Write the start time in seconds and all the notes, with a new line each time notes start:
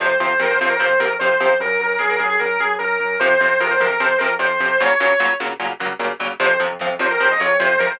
0.00 F2 C3 F3 C5, kick, closed hi-hat
0.09 kick
0.20 F2 C3 F3 C5, kick, closed hi-hat
0.30 kick
0.39 F2 C3 F3 A#4, kick, snare
0.50 C5, kick
0.59 F2 C3 F3 C5, kick, closed hi-hat
0.70 A#4, kick
0.79 F2 C3 F3 C5, kick, closed hi-hat
0.90 kick
1.00 F2 C3 F3 A#4, kick, closed hi-hat
1.10 kick
1.19 F2 C3 F3 C5, kick, snare
1.30 kick
1.39 F2 C3 F3, kick, closed hi-hat
1.49 kick
1.60 F#2 A#4, kick, closed hi-hat
1.69 kick
1.80 F#2 A#4, kick, closed hi-hat
1.89 kick
1.99 F#2 G#4, kick, snare
2.09 A#4, kick
2.18 F#2 G#4, kick, closed hi-hat
2.29 G#4, kick
2.39 F#2 A#4, kick, closed hi-hat
2.51 kick
2.60 F#2 G#4, kick, closed hi-hat
2.69 kick
2.79 F#2 A#4, kick, snare
2.90 kick
3.00 F#2, kick, closed hi-hat
3.11 kick
3.20 F2 C3 F3 C5, kick, closed hi-hat
3.31 kick
3.39 F2 C3 F3 C5, kick, closed hi-hat
3.50 kick
3.60 F2 C3 F3 A#4, kick, snare
3.70 C5, kick
3.79 F2 C3 F3 A#4, kick, closed hi-hat
3.91 A#4, kick
4.00 F2 C3 F3 C5, kick, closed hi-hat
4.09 kick
4.18 F2 C3 F3 A#4, kick, closed hi-hat
4.30 kick
4.39 F2 C3 F3 C5, kick, snare
4.50 kick
4.60 F2 C3 F3, kick, closed hi-hat
4.70 kick
4.79 A#2 C#3 F#3 C#5, kick, closed hi-hat
4.90 kick
5.00 A#2 C#3 F#3, kick, closed hi-hat
5.10 kick
5.19 A#2 C#3 F#3, kick, snare
5.29 kick
5.40 A#2 C#3 F#3, kick, closed hi-hat
5.51 kick
5.60 A#2 C#3 F#3, kick, closed hi-hat
5.70 kick
5.79 A#2 C#3 F#3, kick, closed hi-hat
5.91 kick
5.99 A#2 C#3 F#3, kick, snare
6.12 kick
6.19 A#2 C#3 F#3, kick, closed hi-hat
6.31 kick
6.40 F2 C3 F3 C5, kick, closed hi-hat
6.50 kick
6.60 F2 C3 F3, closed hi-hat
6.70 kick
6.79 F2 C3 F3, kick, snare
6.90 kick
6.99 F2 C3 F3 C5, kick, closed hi-hat
7.10 A#4, kick
7.19 F2 C3 F3 C5, kick, closed hi-hat
7.30 D#5, kick
7.39 F2 C3 F3 C#5, kick, closed hi-hat
7.49 kick
7.60 F2 C3 F3 C5, kick, snare
7.70 kick
7.79 F2 C3 F3 A#4, kick, closed hi-hat
7.90 C5, kick